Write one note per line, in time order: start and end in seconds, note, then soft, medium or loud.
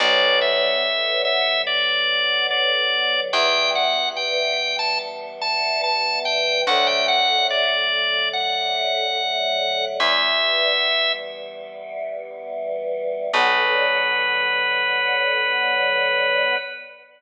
0.00 3.07 B1 loud
0.00 3.30 D3 medium
0.00 3.30 F#3 medium
0.00 3.30 B3 medium
0.00 0.39 D5 loud
0.41 1.22 E5 medium
1.25 1.62 E5 medium
1.67 2.47 D5 medium
2.51 3.20 D5 medium
3.33 6.40 E2 loud
3.33 6.64 E3 medium
3.33 6.64 G3 medium
3.33 6.64 B3 medium
3.33 3.71 G5 medium
3.75 4.09 F#5 medium
4.16 4.76 G5 medium
4.79 4.99 A5 medium
5.41 5.82 A5 medium
5.84 6.19 A5 medium
6.25 6.62 G5 medium
6.67 9.74 D2 loud
6.67 9.97 D3 medium
6.67 9.97 F#3 medium
6.67 9.97 A3 medium
6.67 6.87 F#5 medium
6.87 7.07 G5 medium
7.08 7.47 F#5 medium
7.50 8.29 D5 medium
8.33 9.85 F#5 medium
10.00 13.07 E2 loud
10.00 13.30 E3 medium
10.00 13.30 G3 medium
10.00 13.30 B3 medium
10.00 11.12 E5 medium
13.33 16.56 B1 loud
13.33 16.55 D3 loud
13.33 16.55 F#3 loud
13.33 16.55 B3 loud
13.33 16.56 B4 loud